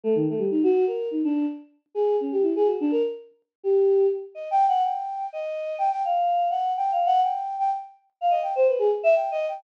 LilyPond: \new Staff { \time 5/8 \tempo 4 = 125 a16 ees16 a16 g16 ees'16 ges'8 bes'8 ees'16 | d'8 r4 aes'8 des'16 g'16 | e'16 aes'16 ges'16 d'16 bes'16 r4 r16 | g'4 r8 \tuplet 3/2 { ees''8 g''8 ges''8 } |
g''4 ees''4 g''16 g''16 | f''4 ges''8 \tuplet 3/2 { g''8 f''8 ges''8 } | g''8. g''16 r4 f''16 ees''16 | g''16 c''16 b'16 aes'16 r16 e''16 \tuplet 3/2 { g''8 ees''8 g''8 } | }